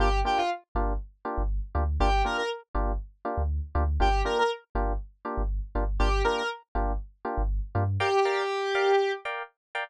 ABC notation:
X:1
M:4/4
L:1/16
Q:1/4=120
K:Gm
V:1 name="Lead 1 (square)"
G2 G F z12 | G2 B B z12 | G2 B B z12 | G2 B B z12 |
G10 z6 |]
V:2 name="Electric Piano 1"
[B,DFG]2 [B,DFG]4 [B,DFG]4 [B,DFG]4 [B,DFG]2 | [B,DFG]2 [B,DFG]4 [B,DFG]4 [B,DFG]4 [B,DFG]2 | [B,DFG]2 [B,DFG]4 [B,DFG]4 [B,DFG]4 [B,DFG]2 | [B,DFG]2 [B,DFG]4 [B,DFG]4 [B,DFG]4 [B,DFG]2 |
[Bdfg]2 [Bdfg]4 [Bdfg]4 [Bdfg]4 [Bdfg]2 |]
V:3 name="Synth Bass 2" clef=bass
G,,,6 G,,,5 G,,,3 D,,2 | G,,,6 G,,,5 D,,3 D,,2 | G,,,6 G,,,5 G,,,3 G,,,2 | G,,,6 G,,,5 G,,,3 G,,2 |
z16 |]